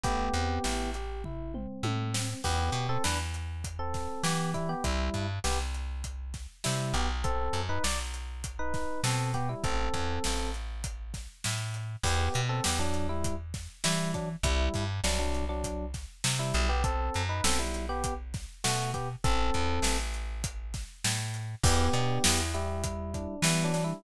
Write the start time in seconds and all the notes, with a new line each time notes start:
0.04 A1 A3 B3 G4, kick, closed hi-hat
0.33 E2 C4, closed hi-hat
0.64 A1 E4, snare
0.94 G4, closed hi-hat
1.24 E4, kick, floor tom
1.54 C4, mid tom
1.83 A2 A3, high tom
2.14 C4, snare
2.44 E2 B3 G4, kick, crash
2.72 B2, closed hi-hat
2.89 C4 A4
3.04 E2 D4 B4, snare
3.34 closed hi-hat
3.64 kick, closed hi-hat
3.79 C4 A4
3.94 kick, snare, closed hi-hat
4.24 E3 B3 G4, snare
4.54 G3 E4, kick, closed hi-hat
4.69 B3 G4
4.84 C2 G3 E4, kick, closed hi-hat
5.14 G2, kick, closed hi-hat
5.44 C2 B3 G4, snare
5.75 closed hi-hat
6.04 kick, closed hi-hat
6.34 kick, snare, closed hi-hat
6.64 C3 G3 E4, snare
6.94 B1 B3 G4, closed hi-hat
7.24 C4 A4, kick, closed hi-hat
7.53 F#2, closed hi-hat
7.69 D#4 B4
7.84 B1 D5, snare
8.14 closed hi-hat
8.44 kick, closed hi-hat
8.59 D#4 B4
8.74 kick, snare, closed hi-hat
9.04 B2 C4 A4, snare
9.34 B3 G4, kick, closed hi-hat
9.49 G3 E4
9.64 A1 C4 A4, kick, closed hi-hat
9.94 E2, kick, closed hi-hat
10.24 A1, snare
10.54 closed hi-hat
10.84 kick, closed hi-hat
11.14 kick, snare, closed hi-hat
11.44 A2, snare
11.74 closed hi-hat
12.04 E2 B3 G4, kick, crash
12.34 B2, closed hi-hat
12.49 C4 A4
12.64 E2 B3 G4, snare
12.79 F#3 D4
12.94 closed hi-hat
13.09 G3 E4
13.24 kick, closed hi-hat
13.54 kick, snare, closed hi-hat
13.84 E3 G3 E4, snare
14.14 F#3 D4, kick, closed hi-hat
14.43 C2 G3 E4, kick, closed hi-hat
14.74 G2, kick, closed hi-hat
15.04 C2 F#3 D4, snare
15.19 F#3 D4
15.35 closed hi-hat
15.49 F#3 D4
15.64 kick, closed hi-hat
15.94 kick, snare, closed hi-hat
16.24 C3, snare
16.39 G3 E4
16.54 B1, closed hi-hat
16.69 B3 G4
16.84 C4 A4, kick, closed hi-hat
17.14 F#2, closed hi-hat
17.29 D#4 B4
17.44 B1 C4 A4, snare
17.59 G3 E4
17.74 closed hi-hat
17.89 B3 G4
18.04 kick, closed hi-hat
18.34 kick, snare, closed hi-hat
18.64 B2 A3 F#4, snare
18.94 B3 G4, kick, closed hi-hat
19.24 A1 C4 A4, kick, closed hi-hat
19.54 E2, kick, closed hi-hat
19.82 A1, snare
20.14 closed hi-hat
20.44 kick, closed hi-hat
20.74 kick, snare, closed hi-hat
21.04 A2, snare
21.34 closed hi-hat
21.64 E2 B3 G4, kick, crash
21.93 B2 D4, closed hi-hat
22.24 E2 E4, snare
22.54 G3 E4 G4, closed hi-hat
22.84 E4, kick, closed hi-hat
23.14 D4, kick, closed hi-hat
23.42 E3 G3 B3 E4, snare
23.64 F#3 D4
23.73 D4, snare, closed hi-hat
23.84 G3 E4